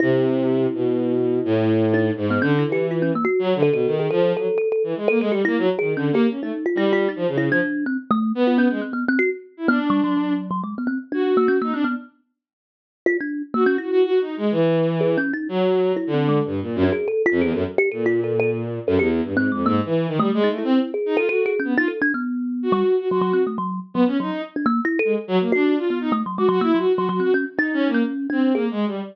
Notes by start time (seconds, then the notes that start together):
0.00 C3 E4
0.74 B2
1.45 A2
1.94 D#4
2.17 G#2
2.30 B3
2.42 D3 C#4
2.59 E4
2.67 E3
2.72 G4
2.91 F4
3.02 C#4
3.15 A#3
3.25 F#4
3.39 F#3
3.55 D3
3.63 A4
3.72 B2 A4
3.86 D#3
3.99 G#4
4.11 F3 A4
4.36 F#3 A4
4.58 A4
4.72 A4
4.84 E3
4.96 G#3
5.08 A#3 A4
5.20 G#3 A4
5.31 G3 G4
5.45 A#3 E4
5.58 F#3
5.79 D#3 G#4
5.95 D3 C#4
6.12 A#3 G4
6.29 C#4
6.41 A3 D#4
6.66 F4
6.75 G3 E4
6.93 F4
7.09 D#4
7.16 F3
7.27 C#3
7.38 E4
7.50 F3 D4
7.86 C4
8.11 A3
8.35 B3
8.47 F4
8.58 C#4
8.70 G#3
8.82 C4
8.93 B3
9.08 C4
9.19 F#4
9.57 E4
9.68 B3 D4
9.90 G3
10.04 F#3
10.17 F#3
10.51 F#3
10.64 G#3
10.78 B3
10.87 C4
11.12 D4 F#4
11.37 A#3
11.48 C#4
11.62 A#3 D#4
11.73 C4 D4
11.84 B3
13.06 F4
13.21 D4
13.54 A#3 F#4
13.66 C#4
13.78 E4 F#4
13.91 F#4
14.04 F#4
14.21 D#4
14.37 G#3
14.51 E3
15.01 G#4
15.17 C#4
15.33 D#4
15.49 F#3
15.96 E4
16.07 D3
16.14 C4
16.29 G#3
16.45 G2
16.61 A#2
16.76 F#2
16.83 D4
16.92 G#4
17.08 A4
17.26 F4
17.31 F2
17.41 E2 G#4
17.52 F#2 A4
17.78 G4
17.92 A#2 A4
18.06 F4
18.24 A4
18.40 A4
18.87 F#2 A4
18.99 E2 G4
19.23 G2
19.34 G#2 C4
19.52 F2 G#3
19.66 G#2 A#3
19.85 E3
20.08 D#3
20.19 G3 A3
20.34 G#3
20.44 D#4
20.49 A3
20.58 E4
20.64 C4
20.94 G#4
21.06 D#4
21.16 F4 A4
21.29 F#4 A4
21.46 G#4
21.60 C#4
21.64 B3
21.77 D#4 F4
21.88 A4
22.02 D4
22.14 B3
22.63 F#4
22.72 G3
22.99 F#4
23.09 F#3 F#4
23.21 F#3
23.33 C4
23.47 A3
23.58 F#3
23.94 F#3 B3
24.07 C#4
24.20 F#3 D#4
24.56 D4
24.66 A#3
24.85 E4
24.99 A4
25.05 G#3
25.28 F#3
25.40 A#3
25.52 D4 F#4
25.77 F4
25.90 B3
26.01 D#4
26.12 A3
26.26 F#3
26.38 G#3 F#4
26.49 F#3 F#4
26.61 A#3 E4
26.74 F#3 F#4
26.94 F#4
26.98 F#3
27.09 F#3 F#4
27.20 C4 F#4
27.34 C#4
27.57 D#4
27.73 C#4
27.88 A#3
27.94 C#4
28.30 C4 D4
28.54 A#3 G#4
28.71 G#3
28.87 G3